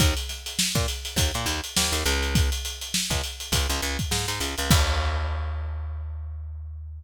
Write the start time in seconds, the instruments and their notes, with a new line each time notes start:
0.00 electric bass (finger) D#2, kick, closed hi-hat
0.17 closed hi-hat
0.29 snare, closed hi-hat
0.46 closed hi-hat
0.59 snare
0.75 electric bass (finger) A#2, kick, closed hi-hat
0.88 closed hi-hat
1.05 closed hi-hat
1.16 electric bass (finger) D#2, kick, closed hi-hat
1.34 electric bass (finger) A#2, closed hi-hat
1.46 electric bass (finger) D#2, closed hi-hat
1.64 closed hi-hat
1.76 electric bass (finger) D#2, snare
1.92 electric bass (finger) D#2, closed hi-hat
2.06 electric bass (finger) C#2, snare, closed hi-hat
2.23 closed hi-hat
2.35 kick, closed hi-hat
2.52 closed hi-hat
2.65 closed hi-hat
2.81 closed hi-hat
2.94 snare
3.10 electric bass (finger) C#2, kick, closed hi-hat
3.24 closed hi-hat
3.40 closed hi-hat
3.52 electric bass (finger) C#2, kick, closed hi-hat
3.69 electric bass (finger) C#2, snare, closed hi-hat
3.82 electric bass (finger) C#2, closed hi-hat
3.99 kick, closed hi-hat
4.11 electric bass (finger) G#2, snare
4.28 electric bass (finger) G#2, closed hi-hat
4.40 electric bass (finger) C#2, closed hi-hat
4.58 electric bass (finger) C#2, closed hi-hat
4.70 electric bass (finger) D#2, kick, crash